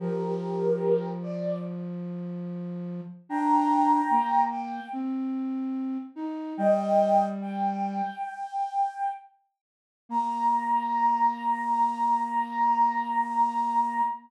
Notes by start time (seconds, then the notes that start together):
0.00 F3 G4 A#4
1.23 D5
3.29 D4 G5 A#5
4.10 A#3
4.50 G5
4.93 C4
6.16 D#4
6.57 G3 D#5 G5
7.42 G5
10.09 A#3 A#5